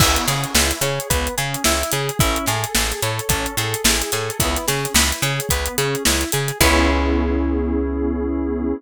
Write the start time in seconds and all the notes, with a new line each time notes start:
0.00 C#2 B3 E4, kick, crash
0.16 closed hi-hat
0.27 C#3 C#4 G#4, snare, closed hi-hat
0.44 closed hi-hat
0.55 C#2 E4 B4, snare
0.71 closed hi-hat
0.81 C#3 G#4 C#5, closed hi-hat
1.00 closed hi-hat
1.10 C#2 B3 B4, kick, closed hi-hat
1.27 closed hi-hat
1.38 C#3 C#4 G#4, closed hi-hat
1.54 closed hi-hat
1.64 C#2 E4, snare
1.83 closed hi-hat
1.92 C#3 G#4, closed hi-hat
2.09 closed hi-hat
2.19 A1 C#4 E4, kick, closed hi-hat
2.36 closed hi-hat
2.46 A2 G#4 A4, snare, closed hi-hat
2.64 closed hi-hat
2.75 A1 G#4 A4, snare
2.91 snare, closed hi-hat
3.03 A2 A4 C#5, closed hi-hat
3.19 closed hi-hat
3.29 A1 C#4 A4, kick, closed hi-hat
3.46 closed hi-hat
3.57 A2 G#4 A4, snare, closed hi-hat
3.74 closed hi-hat
3.84 A1 E4 G#4, snare
4.02 closed hi-hat
4.12 A2 G#4 A4, closed hi-hat
4.30 closed hi-hat
4.40 C#2 B3 E4, kick, closed hi-hat
4.56 snare, closed hi-hat
4.68 C#3 C#4 G#4, snare, closed hi-hat
4.85 closed hi-hat
4.94 C#2 E4 B4, snare
5.12 closed hi-hat
5.22 C#3 G#4 C#5, closed hi-hat
5.40 closed hi-hat
5.49 C#2 B3 B4, kick, closed hi-hat
5.66 closed hi-hat
5.78 C#3 C#4 G#4, closed hi-hat
5.95 closed hi-hat
6.05 C#2 E4, snare
6.21 closed hi-hat
6.32 C#3 G#4, closed hi-hat
6.48 closed hi-hat
6.60 C#2 B3 C#4 E4 G#4 B4 C#5, kick, crash